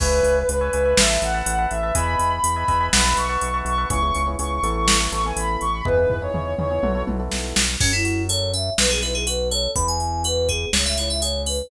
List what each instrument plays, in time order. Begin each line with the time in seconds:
0.00 synth bass 1 C#2, ocarina B4, electric piano 1 B4 C#5 E5 G#5, kick, crash
0.23 synth bass 1 C#2, closed hi-hat
0.37 ocarina B4
0.49 synth bass 1 C#2, ocarina B4, closed hi-hat
0.61 electric piano 1 B4 C#5 E5 G#5
0.73 synth bass 1 C#2, electric piano 1 B4 C#5 E5 G#5, closed hi-hat
0.85 electric piano 1 B4 C#5 E5 G#5
0.97 synth bass 1 A1, electric piano 1 B4 E5 A5, ocarina E5, snare
1.10 electric piano 1 B4 E5 A5
1.22 synth bass 1 A1, ocarina F#5, closed hi-hat
1.34 electric piano 1 B4 E5 A5
1.46 synth bass 1 A1, closed hi-hat
1.59 electric piano 1 B4 E5 A5
1.71 synth bass 1 A1, ocarina E5, closed hi-hat
1.83 electric piano 1 B4 E5 A5
1.95 synth bass 1 E2, electric piano 1 B4 D#5 E5 G#5, ocarina B5, kick, closed hi-hat
2.19 synth bass 1 E2, closed hi-hat
2.32 ocarina B5
2.44 synth bass 1 E2, ocarina B5, closed hi-hat
2.56 electric piano 1 B4 D#5 E5 G#5
2.68 synth bass 1 E2, electric piano 1 B4 D#5 E5 G#5, kick, closed hi-hat
2.80 electric piano 1 B4 D#5 E5 G#5
2.93 synth bass 1 B1, electric piano 1 B4 E5 F#5 A5, ocarina B5, snare
3.05 electric piano 1 B4 E5 F#5 A5
3.17 synth bass 1 B1, ocarina C#6, closed hi-hat
3.29 electric piano 1 B4 E5 F#5 A5
3.41 synth bass 1 B1, closed hi-hat
3.54 electric piano 1 B4 E5 F#5 A5
3.65 synth bass 1 B1, ocarina C#6, closed hi-hat
3.78 electric piano 1 B4 E5 F#5 A5
3.90 synth bass 1 C#2, electric piano 1 B3 C#4 E4 G#4, ocarina C#6, kick, closed hi-hat
4.02 electric piano 1 B3 C#4 E4 G#4
4.15 synth bass 1 C#2, closed hi-hat
4.27 electric piano 1 B3 C#4 E4 G#4
4.39 synth bass 1 C#2, electric piano 1 B3 C#4 E4 G#4, ocarina C#6, closed hi-hat
4.51 ocarina C#6
4.63 synth bass 1 A1, electric piano 1 B3 E4 A4, closed hi-hat
4.75 ocarina C#6
4.88 ocarina C#6, snare
5.00 electric piano 1 B3 E4 A4
5.12 synth bass 1 A1, electric piano 1 B3 E4 A4, ocarina C#6, closed hi-hat
5.24 electric piano 1 B3 E4 A4, ocarina G#5
5.36 synth bass 1 A1, ocarina B5, closed hi-hat
5.61 synth bass 1 A1, ocarina C#6, closed hi-hat
5.73 ocarina B5
5.85 synth bass 1 E2, electric piano 1 B3 D#4 E4 G#4, ocarina B4, kick, floor tom
5.97 electric piano 1 B3 D#4 E4 G#4
6.10 synth bass 1 E2, floor tom
6.22 electric piano 1 B3 D#4 E4 G#4, ocarina C#5
6.34 synth bass 1 E2, electric piano 1 B3 D#4 E4 G#4, mid tom
6.58 synth bass 1 E2, electric piano 1 B3 D#4 E4 G#4, ocarina C#5, mid tom
6.71 electric piano 1 B3 D#4 E4 G#4
6.83 synth bass 1 B1, electric piano 1 B3 E4 F#4 A4, high tom
6.95 electric piano 1 B3 E4 F#4 A4
7.07 synth bass 1 B1, electric piano 1 B3 E4 F#4 A4, high tom
7.19 electric piano 1 B3 E4 F#4 A4
7.32 synth bass 1 B1, snare
7.56 synth bass 1 B1, snare
7.80 synth bass 1 F#2, electric piano 1 C#4, electric piano 2 C#4, kick, crash
7.93 electric piano 2 E4
8.05 electric piano 1 F#4, closed hi-hat
8.29 electric piano 1 A4, electric piano 2 C#5, closed hi-hat
8.53 electric piano 1 C#4, electric piano 2 E5, closed hi-hat
8.78 synth bass 1 B1, electric piano 1 B3, electric piano 2 B4, snare
8.90 electric piano 2 G#4
9.02 electric piano 1 E4, electric piano 2 B4, closed hi-hat
9.15 electric piano 2 G#4
9.27 electric piano 1 F#4, electric piano 2 B4, closed hi-hat
9.51 electric piano 1 A4, electric piano 2 C#5, closed hi-hat
9.76 synth bass 1 E2, electric piano 1 B3, electric piano 2 B5, kick, closed hi-hat
9.88 electric piano 2 G#5
10.00 electric piano 1 E4, closed hi-hat
10.24 electric piano 1 F#4, electric piano 2 B4, closed hi-hat
10.49 electric piano 1 B3, electric piano 2 G#4, kick, closed hi-hat
10.73 synth bass 1 C#2, electric piano 1 C#4, electric piano 2 C#5, snare
10.86 electric piano 2 E5
10.97 electric piano 1 E4, electric piano 2 C#5, closed hi-hat
11.10 electric piano 2 E5
11.22 electric piano 1 G#4, electric piano 2 C#5, closed hi-hat
11.46 electric piano 1 C#4, electric piano 2 B4, open hi-hat